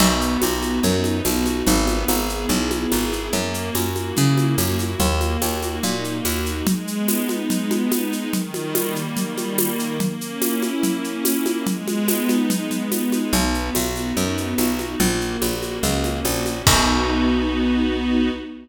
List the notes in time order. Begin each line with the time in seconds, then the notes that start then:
0.00 B1 B3, crash, low conga, shaker
0.20 F#4, shaker
0.41 B1 B3, tambourine, high conga, shaker
0.62 D#4, high conga, shaker
0.83 F#2 B3, low conga, shaker
1.04 F#4, high conga, shaker
1.25 B1 D#4, tambourine, high conga, shaker
1.45 B3, high conga, shaker
1.67 G#1 B3, low conga, shaker
1.87 G#4, high conga, shaker
2.08 G#1 B3, tambourine, high conga, shaker
2.28 E4, shaker
2.49 B1 B3, low conga, shaker
2.70 G#4, high conga, shaker
2.92 G#1 E4, tambourine, high conga, shaker
3.12 B3, shaker
3.32 F#2 A#3, low conga, shaker
3.53 F#4, shaker
3.75 F#2 A#3, tambourine, high conga, shaker
3.95 E4, high conga, shaker
4.17 C#3 A#3, low conga, shaker
4.37 F#4, high conga, shaker
4.58 F#2 E4, tambourine, high conga, shaker
4.79 A#3, high conga, shaker
4.99 D#2 A#3, low conga, shaker
5.21 F#4, high conga, shaker
5.42 D#2 A#3, tambourine, high conga, shaker
5.62 D#4, high conga, shaker
5.83 A#2 A#3, low conga, shaker
6.04 F#4, shaker
6.25 D#2 D#4, tambourine, high conga, shaker
6.46 A#3, shaker
6.66 G#3, low conga, shaker
6.87 B3, shaker
7.08 D#4, tambourine, high conga, shaker
7.29 G#3, high conga, shaker
7.50 B3, low conga, shaker
7.71 D#4, high conga, shaker
7.92 G#3, tambourine, high conga, shaker
8.13 B3, shaker
8.33 D#3, low conga, shaker
8.54 G3, high conga, shaker
8.75 A#3, tambourine, high conga, shaker
8.96 D#3, shaker
9.17 G3, low conga, shaker
9.38 A#3, high conga, shaker
9.57 D#3, tambourine, high conga, shaker
9.78 G3, shaker
10.00 A#3, low conga, shaker
10.20 C#4, shaker
10.40 E4, tambourine, high conga, shaker
10.62 A#3, high conga, shaker
10.83 C#4, low conga, shaker
11.04 E4, shaker
11.25 A#3, tambourine, high conga, shaker
11.46 C#4, high conga, shaker
11.67 G#3, low conga, shaker
11.86 B3, high conga, shaker
12.08 D#4, tambourine, high conga, shaker
12.29 G#3, high conga, shaker
12.50 B3, low conga, shaker
12.71 D#4, low conga, shaker
12.92 G#3, tambourine, high conga, shaker
13.12 B3, high conga, shaker
13.33 B1 B3, low conga, shaker
13.54 F#4, shaker
13.74 B1 B3, tambourine, high conga, shaker
13.95 D#4, high conga, shaker
14.16 F#2 B3, low conga, shaker
14.37 F#4, shaker
14.58 B1 D#4, tambourine, high conga, shaker
14.79 B3, high conga, shaker
15.00 A#1 A#3, low conga, shaker
15.21 F#4, shaker
15.41 A#1 A#3, tambourine, high conga, shaker
15.62 C#4, high conga, shaker
15.83 C#2 A#3, low conga, shaker
16.04 F#4, high conga, shaker
16.25 A#1 C#4, tambourine, high conga, shaker
16.46 A#3, high conga, shaker
16.66 B1 B3 D#4 F#4, kick, crash